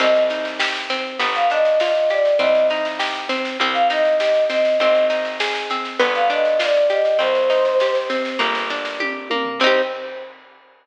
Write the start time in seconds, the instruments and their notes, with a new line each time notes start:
0.00 electric bass (finger) C2, acoustic guitar (steel) C4, choir aahs D#5, kick, snare, crash
0.15 snare
0.30 acoustic guitar (steel) D#4, snare
0.45 snare
0.59 acoustic guitar (steel) G4, snare
0.75 snare
0.90 acoustic guitar (steel) C4, snare
1.19 electric bass (finger) G1, acoustic guitar (steel) B3, kick, snare
1.35 choir aahs F5, snare
1.50 acoustic guitar (steel) D4, choir aahs D#5, snare
1.65 snare
1.80 acoustic guitar (steel) F4, choir aahs D#5, snare
1.95 snare
2.10 acoustic guitar (steel) G4, choir aahs D5, snare
2.25 snare
2.39 electric bass (finger) C2, acoustic guitar (steel) C4, choir aahs D#5, kick, snare
2.55 snare
2.70 acoustic guitar (steel) D#4, snare
2.85 snare
2.99 acoustic guitar (steel) G4, snare
3.15 snare
3.29 acoustic guitar (steel) C4, snare
3.45 snare
3.60 electric bass (finger) C2, acoustic guitar (steel) C4, kick, snare
3.73 choir aahs F5, snare
3.90 acoustic guitar (steel) D#4, choir aahs D#5, snare
4.05 snare
4.19 acoustic guitar (steel) G4, choir aahs D#5, snare
4.35 snare
4.48 acoustic guitar (steel) C4, choir aahs D#5, snare
4.65 snare
4.79 electric bass (finger) G#1, acoustic guitar (steel) C4, choir aahs D#5, kick, snare
4.95 snare
5.10 acoustic guitar (steel) D#4, snare
5.25 snare
5.40 acoustic guitar (steel) G#4, snare
5.55 snare
5.70 acoustic guitar (steel) C4, snare
5.85 snare
6.00 electric bass (finger) G1, acoustic guitar (steel) B3, kick, snare
6.14 choir aahs F5, snare
6.30 acoustic guitar (steel) D4, choir aahs D#5, snare
6.45 snare
6.59 acoustic guitar (steel) F4, choir aahs D5, snare
6.75 snare
6.90 acoustic guitar (steel) G4, choir aahs D#5, snare
7.05 snare
7.19 electric bass (finger) C2, acoustic guitar (steel) C4, choir aahs C5, kick, snare
7.35 snare
7.50 acoustic guitar (steel) D#4, snare
7.65 snare
7.80 acoustic guitar (steel) G4, snare
7.95 snare
8.10 acoustic guitar (steel) C4, snare
8.25 snare
8.39 electric bass (finger) G1, acoustic guitar (steel) A#3, kick, snare
8.55 snare
8.70 acoustic guitar (steel) D4, snare
8.85 snare
9.00 acoustic guitar (steel) G4, kick, high tom
9.30 acoustic guitar (steel) A#3, high tom
9.45 floor tom
9.60 electric bass (finger) C2, acoustic guitar (steel) C4, choir aahs C5, kick, crash
9.64 acoustic guitar (steel) D#4 G4